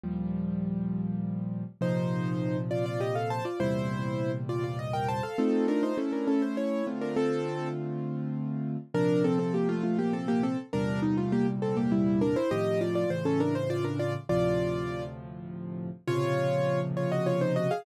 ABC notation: X:1
M:3/4
L:1/16
Q:1/4=101
K:Bb
V:1 name="Acoustic Grand Piano"
z12 | [Ec]6 [Fd] [Fd] [Ge] [Af] [ca] [Fd] | [=Ec]6 [Fd] [Fd] _e [Bg] [ca] [Af] | [CA]2 [DB] [Ec] [^CA] [DB] [CA] ^B [=E^c]2 z [D_B] |
[CA]4 z8 | [DB]2 [CA] [CA] [B,G] [A,F] [A,F] [B,G] [CA] [B,G] [CA] z | [DB]2 E [A,F] [B,G] z [CA] [B,G] [G,=E]2 [DB] [Ec] | [Ge]2 [Fd] [Fd] c [^CA] [DB] =c [Fd] [DB] [Fd] z |
[Fd]6 z6 | [K:Bbm] [Fd]6 [Fd] [Ge] [Fd] [Ec] [Ge] [Af] |]
V:2 name="Acoustic Grand Piano"
[E,,B,,F,G,]12 | [B,,C,F,]12 | [=E,,B,,C,G,]12 | [A,EF]4 [A,^C=E]6 [D,A,=CF]2- |
[D,A,CF]12 | [B,,C,F,]12 | [=E,,B,,C,G,]12 | [A,,C,E,F,]4 [A,,^C,=E,]8 |
[D,,A,,C,F,]12 | [K:Bbm] [B,,C,D,F,]12 |]